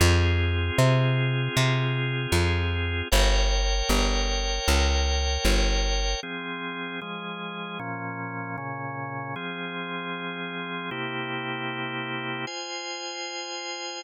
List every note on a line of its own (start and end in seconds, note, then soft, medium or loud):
0.00 0.71 F2 medium
0.00 3.08 C4 medium
0.00 3.08 F4 medium
0.00 3.08 G#4 medium
0.78 1.49 C3 medium
1.57 2.27 C3 medium
2.32 3.02 F2 medium
3.12 3.82 G1 medium
3.12 6.20 A#4 medium
3.12 6.20 C#5 medium
3.12 6.20 G5 medium
3.89 4.59 G1 medium
4.68 5.38 C#2 medium
5.45 6.15 G1 medium
6.23 7.00 F3 medium
6.23 7.00 C4 medium
6.23 7.00 G#4 medium
7.01 7.79 F3 medium
7.01 7.79 G#3 medium
7.01 7.79 G#4 medium
7.79 8.56 A#2 medium
7.79 8.56 F3 medium
7.79 8.56 C#4 medium
8.58 9.35 A#2 medium
8.58 9.35 C#3 medium
8.58 9.35 C#4 medium
9.36 10.90 F3 medium
9.36 10.90 C4 medium
9.36 10.90 G#4 medium
10.91 12.45 C3 medium
10.91 12.45 A#3 medium
10.91 12.45 E4 medium
10.91 12.45 G4 medium
12.47 14.01 F4 medium
12.47 14.01 C5 medium
12.47 14.01 G#5 medium